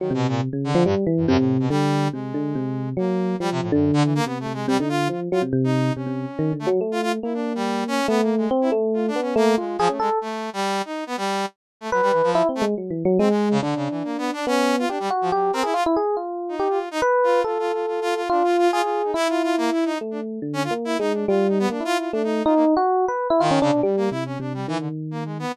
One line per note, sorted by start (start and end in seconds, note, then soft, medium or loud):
0.00 0.13 D#3 medium
0.00 0.11 F#3 medium
0.10 0.27 B2 loud
0.10 0.49 C3 medium
0.28 0.41 A#2 medium
0.53 0.72 C#3 medium
0.64 0.83 D3 loud
0.75 0.84 F3 loud
0.85 0.95 G2 loud
0.85 1.05 G3 medium
1.07 1.26 E3 loud
1.17 1.27 F#2 medium
1.27 1.37 F#2 loud
1.27 1.67 C3 loud
1.38 1.57 A2 medium
1.60 1.69 B2 medium
1.70 2.09 D3 loud
1.70 2.08 G3 loud
2.13 2.32 C3 medium
2.13 2.89 G#3 medium
2.34 2.53 D3 medium
2.55 2.94 C3 medium
2.97 3.35 F#3 medium
2.97 3.36 A#3 medium
3.40 3.69 F3 medium
3.40 3.50 G3 loud
3.51 3.61 C3 loud
3.62 3.71 A2 medium
3.72 3.91 F#2 medium
3.72 4.20 D3 loud
3.93 4.03 D3 loud
4.04 4.14 E3 medium
4.15 4.25 A#3 loud
4.25 4.45 C3 medium
4.25 4.38 B3 medium
4.40 4.53 A3 medium
4.46 4.65 C3 medium
4.53 4.66 G#3 medium
4.68 4.77 C3 loud
4.68 4.77 G3 loud
4.79 5.09 D3 medium
4.79 4.89 D#4 medium
4.89 5.08 F4 loud
5.09 5.29 F3 medium
5.09 5.20 F4 medium
5.32 5.42 F#3 loud
5.32 5.42 F4 medium
5.42 5.52 C3 medium
5.53 5.91 C3 loud
5.64 5.93 D#4 medium
5.96 6.06 C3 medium
5.96 6.53 C#4 medium
6.07 6.26 C3 medium
6.39 6.52 D#3 medium
6.53 6.66 D3 soft
6.59 6.69 A3 medium
6.67 6.80 F#3 loud
6.81 7.19 A3 medium
6.92 7.01 F4 loud
7.02 7.12 F4 loud
7.23 8.00 A#3 medium
7.23 7.33 E4 medium
7.34 7.53 D4 medium
7.55 7.84 G3 loud
7.88 8.07 C#4 loud
8.08 8.47 A3 loud
8.08 8.21 B3 loud
8.22 8.35 A#3 medium
8.37 8.50 G#3 medium
8.51 8.70 C4 loud
8.61 8.71 E4 medium
8.72 9.10 A3 loud
8.94 9.06 F4 medium
9.08 9.21 D4 medium
9.16 9.35 B3 medium
9.22 9.34 C#4 medium
9.36 9.55 A3 loud
9.36 9.55 A#3 loud
9.58 9.77 G#3 medium
9.58 9.77 F4 soft
9.78 9.88 F3 loud
9.78 9.89 G#4 loud
9.89 9.99 A3 medium
9.89 9.98 C#4 medium
10.00 10.09 G#3 medium
10.00 10.19 A4 loud
10.21 10.50 A3 medium
10.53 10.82 G3 loud
10.85 11.04 D#4 medium
11.07 11.16 B3 loud
11.17 11.46 G3 loud
11.81 11.90 A3 medium
11.92 12.01 F#3 medium
11.92 12.30 B4 loud
12.02 12.12 G3 loud
12.12 12.22 E3 medium
12.23 12.42 F3 loud
12.35 12.48 E4 loud
12.49 12.62 C4 medium
12.55 12.65 A3 loud
12.62 12.74 G#3 medium
12.78 12.91 F#3 medium
12.91 13.03 E3 medium
13.05 13.18 F#3 loud
13.19 13.58 G#3 loud
13.19 13.29 C4 medium
13.30 13.49 G#3 medium
13.51 13.61 C#3 loud
13.62 13.74 D3 medium
13.62 14.39 D4 medium
13.76 13.88 C#3 medium
13.90 14.03 E3 medium
14.04 14.17 A#3 medium
14.18 14.31 B3 loud
14.33 14.46 D4 loud
14.47 14.85 B3 medium
14.47 14.76 C#4 loud
14.79 14.89 F4 loud
14.89 14.98 D4 medium
14.89 15.09 G4 medium
15.00 15.09 G3 loud
15.10 15.30 F#4 medium
15.21 15.31 F3 medium
15.32 15.51 F#3 soft
15.32 15.51 G4 loud
15.53 15.63 C4 loud
15.53 15.64 A#4 medium
15.63 15.74 E4 medium
15.63 15.73 G#4 medium
15.74 15.84 F4 medium
15.74 15.84 F4 loud
15.86 15.96 E4 loud
15.96 16.16 G#4 medium
16.17 16.55 F4 medium
16.49 16.68 D#4 medium
16.59 16.79 G4 medium
16.70 16.89 F4 medium
16.91 17.01 D#4 loud
17.02 17.40 B4 loud
17.23 17.43 F4 medium
17.44 17.58 F4 medium
17.44 18.21 A4 medium
17.59 17.72 F4 medium
17.73 17.86 F4 medium
17.87 18.00 F4 medium
18.02 18.14 F4 loud
18.16 18.28 F4 medium
18.30 18.43 D4 medium
18.30 18.68 F4 loud
18.44 18.57 F4 medium
18.58 18.71 F4 loud
18.72 18.82 F4 loud
18.72 19.11 G#4 medium
18.83 19.02 F4 medium
19.04 19.14 D#4 soft
19.14 19.91 E4 medium
19.14 19.28 E4 loud
19.29 19.42 F4 medium
19.43 19.56 F4 loud
19.58 19.70 A#3 loud
19.72 19.84 E4 medium
19.85 19.98 D#4 medium
20.01 20.39 A3 medium
20.11 20.20 D4 medium
20.42 20.68 D3 medium
20.53 20.63 C#4 loud
20.64 20.74 F4 loud
20.71 20.96 A#3 medium
20.85 20.98 E4 loud
20.99 21.25 G#3 medium
20.99 21.13 D#4 medium
21.13 21.26 D4 soft
21.28 21.67 G3 loud
21.28 21.47 F4 medium
21.49 21.58 D#4 medium
21.59 21.69 B3 loud
21.70 21.79 A#3 medium
21.70 21.83 D4 medium
21.80 22.09 E4 medium
21.85 21.98 F4 loud
21.98 22.11 F4 medium
22.13 22.42 A3 medium
22.13 22.22 D4 medium
22.24 22.43 D#4 medium
22.45 22.74 D#4 loud
22.45 22.54 F4 medium
22.55 22.65 A#3 medium
22.77 23.05 F#4 loud
23.08 23.27 B4 medium
23.30 23.40 E4 loud
23.40 23.59 D#3 loud
23.40 23.50 F4 loud
23.51 23.61 C#4 medium
23.61 23.71 C#3 loud
23.61 23.81 D4 loud
23.72 23.82 B2 medium
23.83 23.96 G3 medium
23.83 24.09 G3 loud
23.97 24.10 A#3 medium
24.11 24.37 C3 soft
24.11 24.24 E4 medium
24.26 24.38 C#4 medium
24.40 24.65 C3 medium
24.40 24.53 D4 medium
24.54 24.67 G3 medium
24.68 25.45 D#3 medium
24.68 24.78 E3 loud
24.79 24.89 D3 medium
25.11 25.24 A#3 medium
25.25 25.38 G#3 medium
25.39 25.52 B3 medium